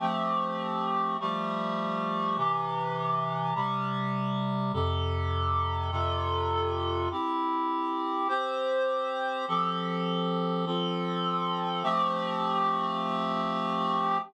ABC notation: X:1
M:3/4
L:1/8
Q:1/4=76
K:F
V:1 name="Clarinet"
[F,A,CG]3 [F,G,A,G]3 | [C,E,G]3 [C,G,G]3 | [F,,C,GA]3 [F,,C,FA]3 | [CEG]3 [CGc]3 |
[F,CGA]3 [F,CFA]3 | [F,A,CG]6 |]